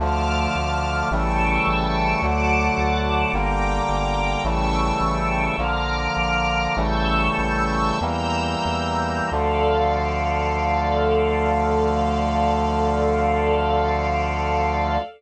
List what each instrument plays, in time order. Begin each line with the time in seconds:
0.00 synth bass 1 D2, brass section D3 F3 A3, string ensemble 1 A5 D6 F6
0.56 synth bass 1 D2
1.11 synth bass 1 A1, brass section C#3 E3 G3 A3, string ensemble 1 G5 A5 C#6 E6
1.67 synth bass 1 A1
2.22 synth bass 1 D2, brass section D3 F#3 A3, string ensemble 1 F#5 A5 D6
2.78 synth bass 1 D2
3.33 synth bass 1 G1, brass section D3 G3 A#3, string ensemble 1 G5 A#5 D6
3.89 synth bass 1 G1
4.44 synth bass 1 A1, brass section C#3 E3 G3 A3, string ensemble 1 G5 A5 C#6 E6
5.01 synth bass 1 A1
5.58 synth bass 1 A#1, brass section D3 F3 A#3, string ensemble 1 A#5 D6 F6
6.17 synth bass 1 A#1
6.76 synth bass 1 A1, brass section C#3 E3 G3 A3, string ensemble 1 A5 C#6 E6 G6
7.38 synth bass 1 A1
8.01 synth bass 1 E2, brass section E3 G3 A#3, string ensemble 1 A#5 E6 G6
8.65 synth bass 1 E2
9.32 synth bass 1 D2, brass section D3 F3 A3, string ensemble 1 A4 D5 F5